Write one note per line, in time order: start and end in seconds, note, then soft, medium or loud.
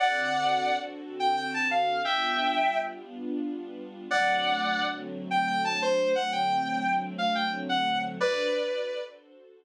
0.00 2.03 D3 loud
0.00 2.03 C4 loud
0.00 2.03 F#4 loud
0.00 2.03 A4 medium
0.00 0.75 D5 medium
0.00 0.75 F#5 loud
1.20 1.36 G5 medium
1.37 1.50 G5 medium
1.54 1.68 A5 medium
1.71 2.02 F5 medium
2.05 4.08 G3 medium
2.05 4.08 B3 loud
2.05 4.08 D4 loud
2.05 4.08 F4 loud
2.05 2.77 E5 medium
2.05 2.77 G5 loud
4.10 6.13 D3 loud
4.10 6.13 F#3 loud
4.10 6.13 A3 loud
4.10 6.13 C4 medium
4.10 4.84 D5 loud
4.10 4.84 F#5 loud
5.31 5.46 G5 medium
5.47 5.61 G5 loud
5.64 5.79 A5 medium
5.82 6.12 C5 loud
6.15 8.18 D3 loud
6.15 8.18 F#3 loud
6.15 8.18 A3 loud
6.15 8.18 C4 loud
6.15 6.31 F#5 loud
6.32 6.93 G5 medium
7.18 7.32 F5 medium
7.35 7.49 G5 medium
7.69 7.98 F#5 loud
8.20 9.64 D4 loud
8.20 9.64 F#4 loud
8.20 9.64 A4 loud
8.20 9.02 B4 loud
8.20 9.64 C5 loud
8.20 9.02 D5 loud